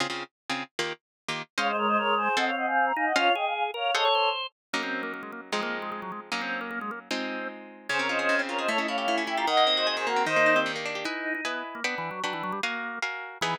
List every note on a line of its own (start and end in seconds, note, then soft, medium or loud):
0.00 0.07 C#3 medium
0.00 0.07 C4 medium
0.00 0.07 F4 medium
0.00 0.07 G#4 medium
0.10 0.24 C#3 medium
0.10 0.24 C4 medium
0.10 0.24 F4 medium
0.10 0.24 G#4 medium
0.50 0.63 C#3 medium
0.50 0.63 C4 medium
0.50 0.63 F4 medium
0.50 0.63 G#4 medium
0.79 0.93 D#3 medium
0.79 0.93 A#3 medium
0.79 0.93 F4 medium
0.79 0.93 G4 medium
1.28 1.42 D#3 medium
1.28 1.42 A#3 medium
1.28 1.42 F4 medium
1.28 1.42 G4 medium
1.58 2.29 G#3 loud
1.58 1.71 C#4 loud
1.58 1.71 C5 loud
1.58 1.67 C#5 medium
1.58 1.71 D#5 loud
1.58 1.71 F5 medium
1.58 1.67 F5 medium
1.68 1.76 C5 medium
1.68 1.76 D#5 medium
1.77 1.87 A#4 medium
1.77 1.87 C#5 medium
1.87 1.97 C5 medium
1.87 1.97 D#5 medium
1.97 2.14 A#4 medium
1.97 2.14 C#5 medium
2.17 2.36 G#4 medium
2.17 2.36 C5 medium
2.37 2.51 C4 loud
2.37 2.92 C4 loud
2.37 2.51 A4 loud
2.37 2.45 D#5 medium
2.37 2.45 F#5 medium
2.37 2.51 F#5 medium
2.37 2.51 G#5 loud
2.47 2.55 C#5 medium
2.47 2.55 F5 medium
2.57 2.66 D#5 medium
2.57 2.66 F#5 medium
2.66 2.85 F5 medium
2.66 2.85 G#5 medium
2.86 2.94 A#5 medium
2.96 3.13 D#4 medium
2.96 3.05 F5 medium
2.96 3.05 G#5 medium
3.06 3.15 D#5 medium
3.06 3.15 F#5 medium
3.16 3.30 C#4 loud
3.16 3.35 F4 loud
3.16 3.30 C5 loud
3.16 3.32 C#5 medium
3.16 3.30 D#5 loud
3.16 3.32 F5 medium
3.16 3.30 F5 loud
3.35 3.71 G#4 medium
3.35 3.45 D#5 medium
3.35 3.45 G5 medium
3.46 3.53 F5 medium
3.46 3.53 G#5 medium
3.55 3.63 F5 medium
3.55 3.63 G#5 medium
3.74 3.91 A#4 medium
3.74 3.92 C#5 medium
3.74 3.92 F5 medium
3.95 4.08 G#4 loud
3.95 4.08 A4 loud
3.95 4.29 A4 medium
3.95 4.08 C5 loud
3.95 4.29 C#5 medium
3.95 4.04 D#5 loud
3.95 4.08 F#5 medium
4.05 4.14 C#5 medium
4.15 4.47 C5 medium
4.73 5.51 F#3 medium
4.73 4.82 A#3 medium
4.73 5.51 A#3 medium
4.73 5.51 C#4 medium
4.73 5.51 D#4 medium
4.83 5.02 C4 medium
5.03 5.12 A#3 medium
5.14 5.22 A#3 medium
5.23 5.31 G#3 medium
5.32 5.41 A#3 medium
5.52 6.30 F3 medium
5.52 5.61 G#3 medium
5.52 6.30 G#3 medium
5.52 6.30 C4 medium
5.52 6.30 D#4 medium
5.63 5.78 A#3 medium
5.82 5.90 G#3 medium
5.92 6.01 G#3 medium
6.02 6.11 F#3 medium
6.12 6.20 G#3 medium
6.32 7.09 F#3 medium
6.32 7.09 A#3 medium
6.32 6.41 A#3 medium
6.32 7.09 C#4 medium
6.32 7.09 D#4 medium
6.41 6.60 C4 medium
6.61 6.70 A#3 medium
6.71 6.79 A#3 medium
6.81 6.91 G#3 medium
6.91 6.99 A#3 medium
7.11 7.88 G#3 medium
7.11 7.48 C4 medium
7.11 7.88 C4 medium
7.11 7.88 D#4 medium
7.11 7.88 F4 medium
7.89 8.28 C#3 loud
7.89 8.42 C#4 loud
7.89 7.98 G#4 medium
7.89 7.98 C5 medium
7.99 8.39 C4 medium
7.99 8.07 A#4 medium
7.99 8.07 C#5 medium
8.09 8.48 F4 medium
8.09 8.18 C5 medium
8.09 8.18 D#5 medium
8.19 8.58 G#4 medium
8.19 8.35 C5 medium
8.19 8.35 D#5 medium
8.29 8.66 C#3 loud
8.39 8.67 C4 medium
8.49 8.68 F4 medium
8.49 8.57 A#4 medium
8.49 8.57 C#5 medium
8.59 8.68 G#4 medium
8.59 8.68 C5 medium
8.59 8.68 D#5 medium
8.68 9.07 A3 loud
8.68 8.77 E4 loud
8.68 8.78 A4 medium
8.68 8.78 C#5 medium
8.78 9.17 C#4 medium
8.78 8.87 E4 loud
8.78 8.87 D#5 medium
8.88 9.27 E4 medium
8.88 8.96 C#5 medium
8.88 8.96 F5 medium
8.97 9.37 G4 medium
8.97 9.15 C#5 medium
8.97 9.15 F5 medium
9.08 9.45 A3 medium
9.08 9.24 E4 loud
9.18 9.46 C#4 medium
9.27 9.35 E4 medium
9.27 9.46 E4 medium
9.27 9.37 E5 medium
9.27 9.37 G5 medium
9.37 9.45 F4 medium
9.37 9.47 G4 medium
9.37 9.46 G5 medium
9.37 9.46 A#5 medium
9.47 9.96 D#3 loud
9.47 9.64 D#5 medium
9.47 9.96 D#5 loud
9.47 9.64 F#5 medium
9.57 10.06 A#3 medium
9.67 10.16 C4 medium
9.77 10.24 F#4 medium
9.77 9.86 C5 medium
9.77 9.86 D#5 medium
9.87 10.24 G#4 medium
9.87 9.95 C5 medium
9.87 9.95 D#5 medium
9.97 10.25 D#3 medium
9.97 10.06 G#4 medium
9.97 10.06 C5 medium
10.06 10.25 A#3 medium
10.06 10.23 F#4 medium
10.06 10.23 A#4 medium
10.16 10.26 C4 medium
10.26 10.65 D#3 loud
10.26 10.54 D#4 loud
10.26 10.59 C5 medium
10.26 10.59 D#5 medium
10.36 10.75 A#3 medium
10.46 10.85 D4 medium
10.56 10.72 C4 loud
10.56 10.95 G4 loud
10.66 11.03 D#3 medium
10.76 11.04 A#3 medium
10.86 11.04 D4 medium
10.95 11.05 G4 medium
11.05 11.34 D#4 medium
11.05 11.41 E4 medium
11.05 11.41 B4 medium
11.05 11.41 D#5 medium
11.05 11.41 G#5 medium
11.35 11.44 D#4 medium
11.45 11.63 B3 medium
11.45 11.80 E4 medium
11.45 11.80 B4 medium
11.45 11.80 D#5 medium
11.45 11.80 G#5 medium
11.75 11.83 A#3 medium
11.84 11.95 B3 medium
11.84 12.20 D4 medium
11.84 12.20 B4 medium
11.84 12.20 F#5 medium
11.84 12.20 G5 medium
11.98 12.10 E3 medium
12.11 12.22 F#3 medium
12.24 12.33 F#3 medium
12.24 12.59 D4 medium
12.24 12.59 B4 medium
12.24 12.59 F#5 medium
12.24 12.59 G5 medium
12.33 12.43 E3 medium
12.43 12.52 F#3 medium
12.52 12.61 G3 medium
12.63 12.99 A#3 medium
12.63 12.99 F#4 medium
12.63 12.99 A#4 medium
12.63 12.99 F5 loud
12.63 12.99 G#5 medium
13.02 13.38 F#4 medium
13.02 13.38 A#4 medium
13.02 13.38 F5 medium
13.02 13.38 G#5 medium
13.41 13.55 E3 loud
13.41 13.56 E3 medium
13.41 13.56 B3 loud
13.41 13.56 D#4 medium
13.41 13.56 G#4 loud